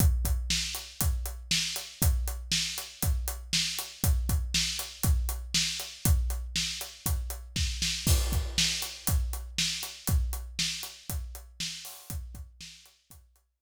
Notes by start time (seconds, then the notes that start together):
0.00 kick, closed hi-hat
0.25 kick, closed hi-hat
0.50 snare
0.75 closed hi-hat
1.01 kick, closed hi-hat
1.26 closed hi-hat
1.51 snare
1.76 closed hi-hat
2.02 kick, closed hi-hat
2.28 closed hi-hat
2.52 snare
2.78 closed hi-hat
3.02 kick, closed hi-hat
3.28 closed hi-hat
3.53 snare
3.79 closed hi-hat
4.04 kick, closed hi-hat
4.29 kick, closed hi-hat
4.54 snare
4.79 closed hi-hat
5.03 kick, closed hi-hat
5.29 closed hi-hat
5.54 snare
5.80 closed hi-hat
6.05 kick, closed hi-hat
6.30 closed hi-hat
6.56 snare
6.81 closed hi-hat
7.06 kick, closed hi-hat
7.30 closed hi-hat
7.56 kick, snare
7.82 snare
8.07 kick, crash
8.32 kick, closed hi-hat
8.58 snare
8.82 closed hi-hat
9.07 kick, closed hi-hat
9.33 closed hi-hat
9.58 snare
9.83 closed hi-hat
10.07 kick, closed hi-hat
10.33 closed hi-hat
10.59 snare
10.83 closed hi-hat
11.10 kick, closed hi-hat
11.35 closed hi-hat
11.60 snare
11.85 open hi-hat
12.10 kick, closed hi-hat
12.35 kick, closed hi-hat
12.61 snare
12.86 closed hi-hat
13.10 kick, closed hi-hat
13.36 closed hi-hat